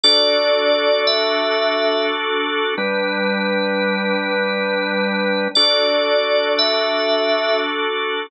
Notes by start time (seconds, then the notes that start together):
0.04 D4 F#4 A4 D5
1.07 E5
2.78 G3 D4 B4
5.55 D4 F#4 A4 D5
6.59 E5